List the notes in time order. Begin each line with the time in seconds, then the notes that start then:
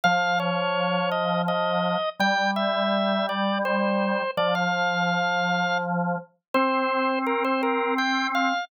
0.04 F3 F5
0.40 C#5
1.11 D#5
1.48 D#5
2.20 G3 G5
2.56 E5
3.29 D5
3.65 C5
4.37 F3 D5
4.55 F5
6.54 C4 C5
7.27 A#4
7.44 C5
7.63 A#4
7.98 G5
8.35 F5